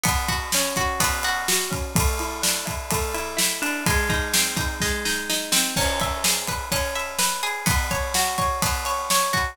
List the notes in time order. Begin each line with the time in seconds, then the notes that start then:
0.03 B3, kick, ride
0.28 F#4, kick, ride
0.52 C#4, snare
0.76 F#4, kick, ride
1.00 B3, kick, ride
1.23 F#4, ride
1.48 F#4, snare
1.71 C#4, kick, ride
1.95 A3, kick, ride
2.19 E4, ride
2.42 D4, snare
2.65 E4, kick, ride
2.91 A3, kick, ride
3.14 E4, ride
3.37 E4, snare
3.62 D4, ride
3.86 G#3, kick, ride
4.09 D#4, kick, ride
4.34 C4, snare
4.56 D#4, kick, ride
4.80 G#3, kick, snare
5.05 D#4, snare
5.29 D#4, snare
5.52 C4, snare
5.76 C#4, kick, crash
6.00 E5, kick, ride
6.24 G#4, snare
6.48 B4, kick, ride
6.72 C#4, kick, ride
6.95 E5, ride
7.19 B4, snare
7.43 G#4, ride
7.66 B3, kick, ride
7.91 C#5, kick, ride
8.14 F#4, snare
8.38 C#5, kick, ride
8.62 B3, kick, ride
8.85 C#5, ride
9.10 C#5, snare
9.33 F#4, kick, ride